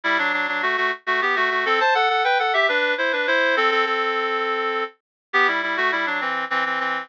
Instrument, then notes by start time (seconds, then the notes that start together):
clarinet
0.04 G3 E4
0.18 F#3 D4
0.33 F#3 D4
0.48 F#3 D4
0.62 A3 F#4
0.77 A3 F#4
1.06 A3 F#4
1.22 B3 G4
1.36 A3 F#4
1.50 A3 F#4
1.66 C4 A4
1.80 C5 A5
1.95 A4 F#5
2.09 A4 F#5
2.24 B4 G5
2.39 A4 F#5
2.54 G4 E5
2.69 D4 B4
2.98 E4 C5
3.12 D4 B4
3.27 E4 C5
3.57 C4 A4
3.71 C4 A4
3.86 C4 A4
5.33 B3 G4
5.47 G3 E4
5.63 G3 E4
5.77 A3 F#4
5.92 G3 E4
6.06 F#3 D4
6.21 E3 C4
6.50 E3 C4
6.66 E3 C4
6.80 E3 C4